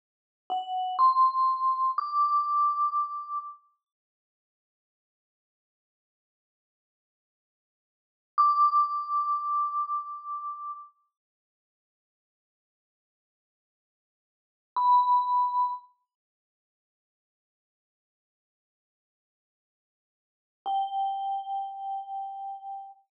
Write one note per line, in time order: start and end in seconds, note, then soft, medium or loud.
0.50 0.97 F#5 medium
0.99 1.91 C6 medium
1.98 3.38 D6 medium
8.38 10.71 D6 medium
14.76 15.71 B5 medium
20.66 22.91 G5 medium